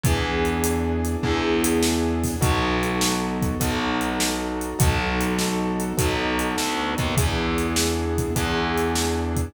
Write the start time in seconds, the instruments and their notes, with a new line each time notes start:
0.03 electric bass (finger) E2, acoustic grand piano B3 D4 E4 G#4, kick, closed hi-hat
0.45 closed hi-hat
0.64 closed hi-hat
1.05 closed hi-hat
1.23 electric bass (finger) E2, acoustic grand piano B3 D4 E4 G#4, kick
1.64 closed hi-hat
1.83 snare
2.24 kick, open hi-hat
2.41 electric bass (finger) B1, acoustic grand piano B3 D#4 F#4 A4, kick, closed hi-hat
2.83 closed hi-hat
3.01 snare
3.42 kick, closed hi-hat
3.60 electric bass (finger) B1, acoustic grand piano B3 D#4 F#4 A4, kick, closed hi-hat
4.01 closed hi-hat
4.20 snare
4.61 closed hi-hat
4.79 electric bass (finger) B1, acoustic grand piano B3 D#4 F#4 A4, kick, closed hi-hat
5.21 closed hi-hat
5.39 snare
5.80 closed hi-hat
5.97 electric bass (finger) B1, acoustic grand piano B3 D#4 F#4 A4, kick, closed hi-hat
6.39 closed hi-hat
6.58 electric bass (finger) D2, snare
6.98 electric bass (finger) D#2, kick, closed hi-hat
7.17 electric bass (finger) E2, acoustic grand piano B3 D4 E4 G#4, kick, closed hi-hat
7.58 closed hi-hat
7.76 snare
8.18 kick, closed hi-hat
8.36 electric bass (finger) E2, acoustic grand piano B3 D4 E4 G#4, kick, closed hi-hat
8.78 closed hi-hat
8.95 snare
9.36 kick, closed hi-hat